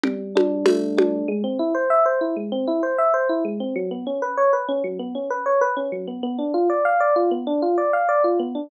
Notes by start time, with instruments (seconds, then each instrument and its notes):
0.03 electric piano 1 G3, low conga
0.35 electric piano 1 D4, high conga
0.66 electric piano 1 A3, tambourine, high conga
0.97 electric piano 1 D4, high conga
1.28 electric piano 1 G#3
1.44 electric piano 1 C4
1.59 electric piano 1 E4
1.74 electric piano 1 C5
1.90 electric piano 1 E5
2.06 electric piano 1 C5
2.21 electric piano 1 E4
2.36 electric piano 1 G#3
2.52 electric piano 1 C4
2.67 electric piano 1 E4
2.83 electric piano 1 C5
2.98 electric piano 1 E5
3.14 electric piano 1 C5
3.29 electric piano 1 E4
3.45 electric piano 1 G#3
3.60 electric piano 1 C4
3.76 electric piano 1 F#3
3.91 electric piano 1 B3
4.07 electric piano 1 C#4
4.22 electric piano 1 B4
4.37 electric piano 1 C#5
4.53 electric piano 1 B4
4.69 electric piano 1 C#4
4.84 electric piano 1 F#3
4.99 electric piano 1 B3
5.15 electric piano 1 C#4
5.30 electric piano 1 B4
5.46 electric piano 1 C#5
5.61 electric piano 1 B4
5.77 electric piano 1 C#4
5.92 electric piano 1 F#3
6.07 electric piano 1 B3
6.23 electric piano 1 B3
6.39 electric piano 1 D4
6.54 electric piano 1 F4
6.70 electric piano 1 D5
6.85 electric piano 1 F5
7.00 electric piano 1 D5
7.16 electric piano 1 F4
7.31 electric piano 1 B3
7.47 electric piano 1 D4
7.62 electric piano 1 F4
7.78 electric piano 1 D5
7.93 electric piano 1 F5
8.09 electric piano 1 D5
8.24 electric piano 1 F4
8.39 electric piano 1 B3
8.55 electric piano 1 D4